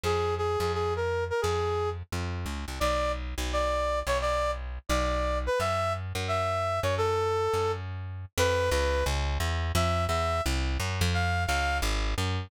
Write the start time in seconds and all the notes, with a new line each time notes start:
0.04 F2 G#4
0.38 G#4
0.60 F2 G#4
0.74 G#4
0.96 A#4
1.30 A#4
1.42 F2 G#4
2.12 F2
2.46 C#2
2.68 C2
2.80 B1 D5
3.38 B1
3.53 D5
4.07 B1 C#5
4.21 D5
4.89 B1 D5
5.47 B4
5.60 F#2 E5
6.15 F#2
6.28 E5
6.83 F#2 C#5
6.98 A4
7.54 F#2
8.38 F2 B4
8.70 C#2 B4
9.06 C#2
9.40 E2
9.75 F2 E5
10.08 E2 E5
10.46 C2
10.80 F#2
11.01 F2
11.14 F5
11.47 C#2 F5
11.82 G#1
12.18 F#2